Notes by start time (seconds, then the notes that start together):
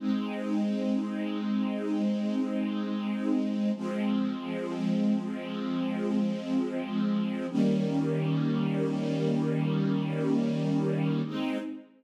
0.00 G#3 C4 D#4
3.75 F3 G#3 C4
7.50 D#3 G3 A#3 C#4
11.25 G#3 C4 D#4